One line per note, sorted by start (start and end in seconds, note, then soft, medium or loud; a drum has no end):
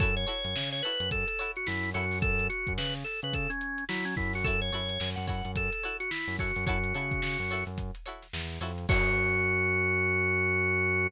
0.00 0.25 F#2 medium
0.00 0.12 E4 loud
0.00 0.12 F#4 loud
0.00 0.15 A4 medium
0.00 0.12 A4 loud
0.00 0.12 C#5 loud
0.00 kick loud
0.00 closed hi-hat medium
0.16 0.70 C#5 medium
0.16 closed hi-hat medium
0.27 0.48 E4 loud
0.27 0.48 F#4 loud
0.27 0.48 A4 loud
0.27 0.48 C#5 loud
0.27 closed hi-hat medium
0.45 0.54 F#2 medium
0.45 closed hi-hat medium
0.56 0.82 C#3 medium
0.56 snare loud
0.72 0.83 C#5 medium
0.72 snare soft
0.72 closed hi-hat medium
0.83 1.05 E4 medium
0.83 1.05 F#4 medium
0.83 1.05 A4 loud
0.83 1.10 B4 medium
0.83 1.05 C#5 loud
0.83 closed hi-hat medium
1.00 1.25 F#2 medium
1.00 closed hi-hat medium
1.11 1.27 A4 medium
1.11 kick medium
1.11 closed hi-hat medium
1.27 1.51 A4 medium
1.27 closed hi-hat medium
1.39 1.60 E4 loud
1.39 1.60 F#4 medium
1.39 1.60 A4 loud
1.39 1.60 C#5 loud
1.39 closed hi-hat medium
1.56 1.67 F#4 medium
1.56 closed hi-hat soft
1.67 1.93 F#2 medium
1.67 1.90 E4 medium
1.67 snare medium
1.83 closed hi-hat medium
1.94 2.48 F#2 medium
1.94 2.06 E4 loud
1.94 2.19 F#4 medium
1.94 2.06 F#4 loud
1.94 2.06 A4 loud
1.94 2.06 C#5 loud
1.94 closed hi-hat medium
2.11 open hi-hat medium
2.22 2.47 A4 medium
2.22 kick loud
2.22 closed hi-hat medium
2.39 closed hi-hat medium
2.50 2.73 F#4 medium
2.50 closed hi-hat medium
2.67 2.78 F#2 medium
2.67 kick medium
2.67 closed hi-hat medium
2.78 3.04 C#3 medium
2.78 2.94 B4 medium
2.78 snare loud
2.95 closed hi-hat medium
3.04 3.20 A4 medium
3.04 closed hi-hat medium
3.22 3.47 C#3 medium
3.22 3.34 B4 medium
3.22 closed hi-hat medium
3.33 3.50 A4 medium
3.33 kick medium
3.33 closed hi-hat medium
3.50 3.84 C#4 medium
3.50 closed hi-hat medium
3.61 closed hi-hat medium
3.78 closed hi-hat medium
3.89 4.15 F#3 medium
3.89 4.05 E4 medium
3.89 snare loud
4.05 4.15 C#4 medium
4.05 closed hi-hat medium
4.17 4.71 F#2 medium
4.17 4.33 E4 medium
4.17 kick medium
4.17 snare soft
4.17 closed hi-hat medium
4.33 4.45 F#4 medium
4.33 open hi-hat medium
4.44 4.57 E4 loud
4.44 4.57 F#4 loud
4.44 4.60 A4 medium
4.44 4.57 A4 loud
4.44 4.57 C#5 loud
4.44 kick medium
4.44 closed hi-hat medium
4.61 5.10 C#5 medium
4.61 closed hi-hat medium
4.72 4.98 F#2 medium
4.72 4.94 E4 loud
4.72 4.94 F#4 loud
4.72 4.94 A4 medium
4.72 4.94 C#5 loud
4.72 closed hi-hat medium
4.89 closed hi-hat medium
5.00 5.16 F#2 medium
5.00 snare medium
5.16 5.42 F#2 medium
5.16 5.26 F#5 medium
5.16 closed hi-hat medium
5.27 5.49 E4 loud
5.27 5.49 F#4 medium
5.27 5.49 A4 loud
5.27 5.49 C#5 loud
5.27 5.52 F#5 medium
5.27 kick medium
5.27 closed hi-hat medium
5.45 5.69 F#2 medium
5.45 closed hi-hat medium
5.56 5.71 A4 medium
5.56 kick medium
5.56 closed hi-hat loud
5.71 5.97 A4 medium
5.71 closed hi-hat medium
5.83 6.05 E4 medium
5.83 6.05 F#4 loud
5.83 6.05 A4 medium
5.83 6.05 C#5 loud
5.83 closed hi-hat medium
6.00 6.10 F#4 medium
6.00 closed hi-hat medium
6.11 6.36 E4 medium
6.11 snare loud
6.28 6.52 F#2 medium
6.28 closed hi-hat medium
6.39 6.51 E4 medium
6.39 6.65 F#4 medium
6.39 6.51 F#4 medium
6.39 6.51 A4 loud
6.39 6.51 C#5 medium
6.39 kick medium
6.39 snare soft
6.39 closed hi-hat medium
6.56 6.66 F#2 medium
6.56 snare soft
6.56 closed hi-hat medium
6.66 6.93 F#2 medium
6.66 6.79 E4 loud
6.66 7.64 F#4 medium
6.66 6.79 F#4 loud
6.66 6.79 A4 loud
6.66 6.79 C#5 loud
6.66 kick medium
6.66 closed hi-hat loud
6.83 closed hi-hat medium
6.94 7.21 C#3 medium
6.94 7.16 E4 medium
6.94 7.16 F#4 loud
6.94 7.16 A4 loud
6.94 7.16 C#5 medium
6.94 closed hi-hat medium
7.11 kick medium
7.11 closed hi-hat medium
7.22 7.37 C#3 medium
7.22 snare loud
7.39 7.64 F#2 medium
7.39 snare soft
7.39 closed hi-hat medium
7.50 7.72 E4 loud
7.50 7.72 F#4 loud
7.50 7.72 A4 loud
7.50 7.72 C#5 medium
7.50 closed hi-hat medium
7.67 7.91 F#2 medium
7.67 closed hi-hat medium
7.78 kick medium
7.78 closed hi-hat medium
7.95 closed hi-hat medium
8.06 8.27 E4 loud
8.06 8.27 F#4 medium
8.06 8.27 A4 loud
8.06 8.27 C#5 loud
8.06 closed hi-hat medium
8.22 snare soft
8.22 closed hi-hat medium
8.33 8.59 E2 medium
8.33 snare loud
8.50 closed hi-hat medium
8.61 8.86 F2 medium
8.61 8.73 E4 loud
8.61 8.73 F#4 loud
8.61 8.73 A4 loud
8.61 8.73 C#5 loud
8.61 closed hi-hat medium
8.78 closed hi-hat medium
8.89 11.07 F#2 loud
8.89 11.07 E4 loud
8.89 11.07 F#4 loud
8.89 11.07 F#4 medium
8.89 11.07 A4 medium
8.89 11.07 C#5 loud
8.89 kick loud
8.89 crash loud